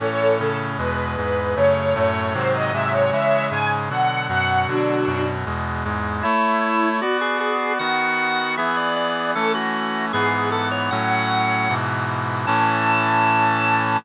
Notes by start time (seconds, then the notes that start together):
0.00 A2 E3 C#4 A4 C#5
0.39 A2 C#3 C#4 A4
0.78 E2 B2 G#3 B4
1.17 E2 G#2 G#3 B4
1.56 F#2 C#3 A3 C#5
1.75 C#5
1.94 F#2 A2 A3 C#5
2.34 G#2 C3 D#3 F#3 C5
2.53 D#5
2.73 G#2 C3 F#3 G#3 E5
2.92 C#5
3.12 C#3 E3 G#3 C#5 E5
3.51 G#2 C#3 G#3 G#5
3.89 B2 D3 F#3 F#5
4.29 F#2 B2 F#3 F#5
4.68 B2 D3 F#3 D4 F#4
5.06 F#2 B2 F#3
5.45 E2 B2 G#3
5.84 E2 G#2 G#3
6.23 A3 E4 C#5
7.01 B3 F#4 D5
7.21 G#4
7.40 G#4
7.79 D#3 B3 F#4 F#5
8.57 E3 B3 G#4 E5
8.77 D5
8.96 D5
9.35 E3 A3 C#4 A4
9.55 F#4
10.13 G#2 E3 B3 G#4
10.52 A4
10.71 C#5
10.91 A2 F#3 C#4 F#5
11.69 G#2 B2 E3
12.47 A2 E3 C#4 A5